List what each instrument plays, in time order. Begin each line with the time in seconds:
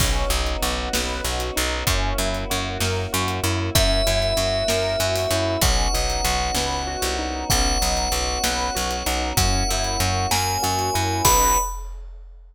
0.00 electric bass (finger) B1, choir aahs B3 C#4 D#4 F#4, acoustic grand piano C#4, kick, crash
0.30 electric bass (finger) B1, acoustic grand piano D#4
0.46 closed hi-hat
0.62 electric bass (finger) B1, acoustic grand piano F#4
0.93 electric bass (finger) B1, acoustic grand piano B4, snare
1.24 electric bass (finger) B1, acoustic grand piano F#4
1.40 closed hi-hat
1.56 electric bass (finger) B1, acoustic grand piano D#4
1.86 electric bass (finger) F#2, choir aahs A#3 C#4 E4 F#4, acoustic grand piano C#4, kick, closed hi-hat
2.18 electric bass (finger) F#2, acoustic grand piano E4
2.34 closed hi-hat
2.50 electric bass (finger) F#2, acoustic grand piano F#4
2.80 electric bass (finger) F#2, acoustic grand piano A#4, snare
3.13 electric bass (finger) F#2, acoustic grand piano F#4
3.28 closed hi-hat
3.44 electric bass (finger) F#2, acoustic grand piano E4
3.74 electric bass (finger) F#2, choir aahs A#3 C#4 E4 F#4, acoustic grand piano C#4, tubular bells E5, kick, closed hi-hat
4.07 electric bass (finger) F#2, acoustic grand piano E4
4.22 closed hi-hat
4.37 electric bass (finger) F#2, acoustic grand piano F#4
4.68 electric bass (finger) F#2, acoustic grand piano A#4, snare
5.00 electric bass (finger) F#2, acoustic grand piano F#4
5.16 open hi-hat
5.31 electric bass (finger) F#2, acoustic grand piano E4
5.61 electric bass (finger) B1, choir aahs B3 C#4 D#4 F#4, acoustic grand piano C#4, tubular bells F#5, kick, closed hi-hat
5.94 electric bass (finger) B1, acoustic grand piano D#4
6.10 closed hi-hat
6.24 electric bass (finger) B1, acoustic grand piano F#4
6.55 electric bass (finger) C#2, acoustic grand piano B4, snare
6.87 acoustic grand piano F#4
7.02 electric bass (finger) C2, closed hi-hat
7.19 acoustic grand piano D#4
7.50 electric bass (finger) B1, choir aahs B3 C#4 D#4 F#4, acoustic grand piano C#4, tubular bells F#5, kick, closed hi-hat
7.81 electric bass (finger) B1, acoustic grand piano D#4
7.97 closed hi-hat
8.12 electric bass (finger) B1, acoustic grand piano F#4
8.43 electric bass (finger) B1, choir aahs B3 C#4 F#4 B4, acoustic grand piano B4, snare
8.75 electric bass (finger) B1, acoustic grand piano F#4
8.91 closed hi-hat
9.06 electric bass (finger) B1, acoustic grand piano D#4
9.37 electric bass (finger) F#2, choir aahs A#3 C#4 E4 F#4, acoustic grand piano C#4, tubular bells F#5, kick, closed hi-hat
9.69 electric bass (finger) F#2, acoustic grand piano E4
9.84 closed hi-hat
10.00 electric bass (finger) F#2, acoustic grand piano F#4
10.31 electric bass (finger) F#2, choir aahs A#3 C#4 F#4 A#4, acoustic grand piano A#4, tubular bells G#5, snare
10.62 electric bass (finger) F#2, acoustic grand piano F#4
10.79 closed hi-hat
10.94 electric bass (finger) F#2, acoustic grand piano E4
11.25 electric bass (finger) B1, choir aahs B3 C#4 D#4 F#4, acoustic grand piano C#4 D#4 F#4 B4, tubular bells B5, kick, crash